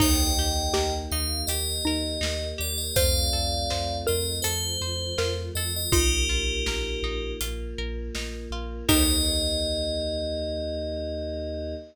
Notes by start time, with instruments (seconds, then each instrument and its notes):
0.00 synth bass 2 D#2, choir aahs A#3 D#4 G4, pizzicato strings D#4, xylophone D#4, tubular bells D#5 G5, kick, crash
0.37 synth bass 2 D#2, pizzicato strings G4
0.73 synth bass 2 D#2, xylophone G4, pizzicato strings A#4, snare
1.11 synth bass 2 D#2, pizzicato strings D#4, tubular bells F5
1.47 synth bass 2 D#2, choir aahs A#3 G4 A#4, pizzicato strings G4, tubular bells D#5, closed hi-hat
1.85 synth bass 2 D#2, xylophone D#4, pizzicato strings A#4
2.21 synth bass 2 D#2, pizzicato strings D#4, snare
2.58 synth bass 2 D#2, pizzicato strings G4, tubular bells D5
2.78 tubular bells D#5
2.96 synth bass 2 F2, choir aahs A3 C4 F4, pizzicato strings F4, xylophone C5, tubular bells D5 F5, kick, closed hi-hat
3.33 synth bass 2 F2, pizzicato strings A4
3.70 synth bass 2 F2, pizzicato strings C5, snare
4.07 synth bass 2 F2, pizzicato strings F4, xylophone A#4, tubular bells D#5
4.42 synth bass 2 F2, choir aahs F3 A3 F4, pizzicato strings A4, tubular bells C5, closed hi-hat
4.81 synth bass 2 F2, pizzicato strings C5
5.18 synth bass 2 F2, pizzicato strings F4, xylophone A#4, snare
5.55 synth bass 2 F2, pizzicato strings A4, tubular bells D#5
5.76 tubular bells D#5
5.92 synth bass 2 A#1, choir aahs A#3 D#4 F4, pizzicato strings D#4, xylophone F4, tubular bells G4 A#4, kick, closed hi-hat
6.29 synth bass 2 A#1, pizzicato strings F4
6.66 synth bass 2 A#1, pizzicato strings A#4, snare
7.03 synth bass 2 A#1, pizzicato strings D#4
7.41 synth bass 2 A#1, choir aahs A#3 F4 A#4, pizzicato strings F4, closed hi-hat
7.78 synth bass 2 A#1, pizzicato strings A#4
8.15 synth bass 2 A#1, pizzicato strings D#4, snare
8.50 synth bass 2 A#1, pizzicato strings F4
8.89 synth bass 2 D#2, choir aahs A#3 D#4 G4, pizzicato strings D#4 G4 A#4, xylophone D#4, tubular bells D#5, kick, crash